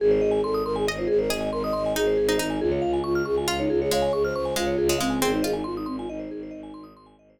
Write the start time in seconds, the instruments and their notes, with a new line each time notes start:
0.00 violin G#1, flute G#4, vibraphone G#4
0.11 vibraphone C5
0.21 violin G#1, vibraphone D#5
0.31 vibraphone G#5
0.43 violin G#1, flute A4, vibraphone C6
0.54 vibraphone D#6
0.65 violin G#1, flute A#4, vibraphone C6
0.76 flute G#4, vibraphone G#5
0.87 violin G#1, vibraphone D#5, pizzicato strings D#5
0.98 flute F4, vibraphone C5
1.07 violin G#1, vibraphone G#4, flute G#4
1.19 flute A#4, vibraphone C5
1.30 violin G#1, pizzicato strings G#4, vibraphone D#5, flute D#5
1.41 vibraphone G#5
1.52 violin G#1, flute A#4, vibraphone C6
1.63 flute D#5, vibraphone D#6
1.73 violin G#1, flute D#5, vibraphone C6
1.86 vibraphone G#5
1.95 violin G#1, pizzicato strings D#4, flute G#4, vibraphone D#5
2.07 vibraphone C5
2.17 violin G#1, vibraphone G#4
2.29 pizzicato strings D#4, vibraphone C5
2.38 violin G#1, flute D#4, pizzicato strings D#4, vibraphone D#5
2.50 vibraphone G#5
2.60 violin C#2, flute F4, vibraphone G#4
2.72 vibraphone C#5
2.82 violin C#2, vibraphone F5
2.93 vibraphone G#5
3.04 violin C#2, flute F4, vibraphone C#6
3.15 vibraphone F6
3.25 violin C#2, flute G#4, vibraphone C#6
3.37 flute F4, vibraphone G#5
3.48 violin C#2, pizzicato strings F4, vibraphone F5
3.59 flute D#4, vibraphone C#5
3.70 violin C#2, flute F4, vibraphone G#4
3.80 flute G#4, vibraphone C#5
3.90 violin C#2, pizzicato strings G#3, flute C#5, vibraphone F5
4.02 vibraphone G#5
4.13 violin C#2, flute G#4, vibraphone C#6
4.24 flute C5, vibraphone F6
4.34 violin C#2, flute C5, vibraphone C#6
4.45 vibraphone G#5
4.56 violin C#2, pizzicato strings G#3, flute F4, vibraphone F5
4.67 vibraphone C#5
4.78 violin C#2, vibraphone G#4
4.89 pizzicato strings G#3, vibraphone C#5
4.98 violin C#2, pizzicato strings G#3, flute C4, vibraphone F5
5.10 vibraphone G#5
5.21 violin G#1, flute C4, pizzicato strings C4, vibraphone G#4
5.33 flute D#4, vibraphone C5
5.42 violin G#1, pizzicato strings F4, flute G#4, vibraphone D#5
5.53 flute D#4, vibraphone G#5
5.64 violin G#1, flute F4, vibraphone C6
5.76 flute D#4, vibraphone D#6
5.86 violin G#1, flute C4, vibraphone C6
5.98 flute F4, vibraphone G#5
6.08 violin G#1, flute D#4, vibraphone D#5
6.19 vibraphone C5
6.31 violin G#1, vibraphone G#4
6.43 vibraphone C5
6.51 violin G#1, vibraphone D#5
6.63 vibraphone G#5
6.74 violin G#1, vibraphone C6
6.84 vibraphone D#6
6.95 violin G#1, vibraphone C6
7.06 vibraphone G#5
7.18 violin G#1, vibraphone D#5
7.30 vibraphone C5
7.38 vibraphone G#4